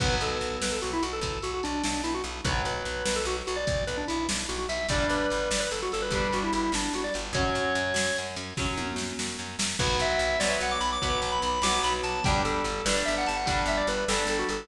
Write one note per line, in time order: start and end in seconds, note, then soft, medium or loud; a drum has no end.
0.00 0.18 B1 loud
0.00 2.20 F#3 medium
0.00 2.20 B3 loud
0.00 0.15 B4 medium
0.00 kick medium
0.00 crash medium
0.21 0.38 B1 medium
0.21 0.56 A4 medium
0.21 closed hi-hat medium
0.41 0.58 B1 medium
0.41 closed hi-hat soft
0.62 0.80 B1 medium
0.62 0.72 B4 medium
0.62 snare medium
0.72 0.81 A4 medium
0.81 1.00 B1 medium
0.81 0.92 F#4 medium
0.81 closed hi-hat medium
0.93 1.03 E4 medium
1.03 1.20 B1 medium
1.03 1.12 F#4 medium
1.03 closed hi-hat medium
1.13 1.39 A4 medium
1.21 1.39 B1 medium
1.21 kick medium
1.21 closed hi-hat medium
1.42 1.61 B1 medium
1.42 1.53 F#4 medium
1.42 closed hi-hat medium
1.54 1.63 F#4 medium
1.63 1.82 B1 medium
1.63 1.83 D4 medium
1.63 closed hi-hat medium
1.84 2.02 B1 medium
1.84 2.02 D4 medium
1.84 snare medium
2.04 2.22 B1 medium
2.04 2.13 E4 medium
2.04 closed hi-hat medium
2.14 2.24 F#4 medium
2.24 2.41 B1 medium
2.24 closed hi-hat medium
2.45 2.62 B1 loud
2.45 4.65 F#3 loud
2.45 4.65 B3 loud
2.45 2.62 B4 medium
2.45 kick medium
2.45 closed hi-hat medium
2.65 2.82 B1 medium
2.65 3.05 B4 medium
2.65 closed hi-hat medium
2.85 3.03 B1 medium
2.85 closed hi-hat medium
3.06 3.25 B1 medium
3.06 3.15 B4 medium
3.06 snare medium
3.16 3.25 A4 medium
3.25 3.43 B1 loud
3.25 3.36 F#4 medium
3.25 closed hi-hat medium
3.47 3.65 B1 loud
3.47 3.57 F#4 medium
3.47 closed hi-hat medium
3.56 3.84 D5 medium
3.67 3.85 B1 medium
3.67 kick medium
3.67 closed hi-hat medium
3.87 4.05 B1 medium
3.87 3.97 B4 medium
3.87 closed hi-hat medium
3.97 4.07 D4 medium
4.08 4.27 B1 medium
4.08 4.27 E4 medium
4.08 closed hi-hat medium
4.29 4.47 B1 medium
4.29 snare medium
4.49 4.66 B1 loud
4.49 4.58 F#4 medium
4.49 closed hi-hat medium
4.58 4.68 F#4 medium
4.69 4.86 B1 medium
4.69 4.87 E5 medium
4.69 open hi-hat medium
4.89 5.06 G1 loud
4.89 6.00 G3 medium
4.89 6.00 D4 loud
4.89 5.07 D5 medium
4.89 kick medium
4.89 closed hi-hat medium
5.09 5.27 G1 medium
5.09 5.49 B4 medium
5.09 closed hi-hat medium
5.30 5.49 G1 medium
5.30 closed hi-hat medium
5.51 5.68 G1 medium
5.51 5.61 D5 medium
5.51 snare medium
5.60 5.70 B4 medium
5.71 5.89 G1 medium
5.71 5.81 A4 medium
5.71 closed hi-hat medium
5.82 5.92 F#4 medium
5.92 6.10 G1 medium
5.92 6.03 A4 medium
5.92 closed hi-hat medium
6.02 6.30 B4 medium
6.10 6.28 G1 loud
6.10 7.22 G3 medium
6.10 7.22 D4 medium
6.10 kick medium
6.10 closed hi-hat medium
6.32 6.51 G1 medium
6.32 6.43 F#4 medium
6.32 closed hi-hat medium
6.43 6.53 E4 medium
6.53 6.70 G1 medium
6.53 6.72 E4 medium
6.53 closed hi-hat medium
6.72 6.89 G1 medium
6.72 6.93 D4 medium
6.72 snare medium
6.93 7.10 G1 medium
6.93 7.05 F#4 medium
6.93 closed hi-hat medium
7.04 7.14 D5 medium
7.14 7.32 G1 loud
7.14 closed hi-hat medium
7.33 7.50 F#2 loud
7.33 8.45 F#3 loud
7.33 8.45 C#4 medium
7.33 8.17 C#5 medium
7.33 kick medium
7.33 closed hi-hat medium
7.55 7.73 F#2 medium
7.55 closed hi-hat medium
7.75 7.93 F#2 loud
7.75 closed hi-hat medium
7.94 8.11 F#2 medium
7.94 snare medium
8.16 8.36 F#2 medium
8.16 closed hi-hat medium
8.36 8.54 F#2 medium
8.36 closed hi-hat medium
8.57 8.75 F#2 medium
8.57 9.68 F#3 medium
8.57 9.68 C#4 medium
8.57 kick medium
8.57 snare medium
8.77 8.95 F#2 medium
8.77 high tom medium
8.96 9.13 F#2 medium
8.96 snare medium
9.19 9.37 F#2 medium
9.19 snare medium
9.39 9.56 F#2 medium
9.59 9.76 F#2 medium
9.59 snare medium
9.79 9.97 B1 loud
9.79 10.34 F#3 loud
9.79 10.34 B3 loud
9.79 9.98 B4 medium
9.79 kick medium
9.79 crash medium
9.99 10.17 B1 loud
9.99 10.39 E5 medium
9.99 closed hi-hat medium
10.19 10.37 B1 loud
10.19 closed hi-hat medium
10.40 10.57 B1 medium
10.40 10.96 F#3 medium
10.40 10.96 B3 medium
10.40 10.49 D5 medium
10.40 snare medium
10.50 10.59 E5 medium
10.61 10.78 B1 medium
10.61 10.72 F#5 medium
10.61 closed hi-hat medium
10.71 10.81 D6 medium
10.81 10.98 B1 medium
10.81 10.90 B5 medium
10.81 closed hi-hat medium
10.92 11.20 D6 medium
11.02 11.20 B1 medium
11.02 11.57 F#3 medium
11.02 11.57 B3 medium
11.02 kick medium
11.02 closed hi-hat medium
11.21 11.39 B1 medium
11.21 11.31 D6 medium
11.21 closed hi-hat medium
11.32 11.42 B5 medium
11.42 11.60 B1 loud
11.42 11.63 B5 medium
11.42 closed hi-hat medium
11.62 11.79 B1 medium
11.62 12.19 F#3 medium
11.62 12.19 B3 medium
11.62 11.82 D6 medium
11.62 snare medium
11.83 12.01 B1 loud
11.83 11.93 B5 medium
11.83 closed hi-hat medium
12.03 12.21 B1 medium
12.03 12.23 A5 medium
12.03 closed hi-hat medium
12.24 12.43 G1 loud
12.24 12.80 G3 loud
12.24 12.80 D4 loud
12.24 12.42 G5 medium
12.24 kick medium
12.24 closed hi-hat medium
12.45 12.62 G1 medium
12.45 12.84 A4 medium
12.45 closed hi-hat medium
12.64 12.82 G1 medium
12.64 closed hi-hat medium
12.86 13.03 G1 loud
12.86 13.41 G3 medium
12.86 13.41 D4 medium
12.86 12.95 B4 medium
12.86 snare medium
12.96 13.06 D5 medium
13.05 13.25 G1 medium
13.05 13.15 E5 medium
13.05 closed hi-hat medium
13.18 13.27 F#5 medium
13.26 13.46 G1 medium
13.26 13.37 A5 medium
13.26 closed hi-hat medium
13.36 13.62 F#5 medium
13.46 13.65 G1 loud
13.46 14.01 G3 medium
13.46 14.01 D4 loud
13.46 kick medium
13.46 closed hi-hat medium
13.66 13.83 G1 loud
13.66 13.78 E5 medium
13.66 closed hi-hat medium
13.77 13.87 D5 medium
13.87 14.05 G1 loud
13.87 14.05 B4 medium
13.87 closed hi-hat medium
14.08 14.26 G1 loud
14.08 14.64 G3 medium
14.08 14.64 D4 medium
14.08 14.27 A4 medium
14.08 snare medium
14.27 14.44 G1 loud
14.27 14.39 A4 medium
14.27 closed hi-hat medium
14.39 14.49 F#4 medium
14.49 14.67 G1 medium
14.49 14.68 A4 medium
14.49 closed hi-hat medium